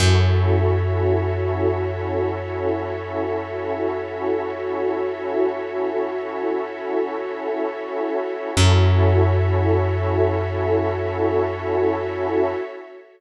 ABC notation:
X:1
M:4/4
L:1/8
Q:1/4=56
K:F#m
V:1 name="Pad 2 (warm)"
[CEFA]8- | [CEFA]8 | [CEFA]8 |]
V:2 name="Pad 5 (bowed)"
[FAce]8- | [FAce]8 | [FAce]8 |]
V:3 name="Electric Bass (finger)" clef=bass
F,,8- | F,,8 | F,,8 |]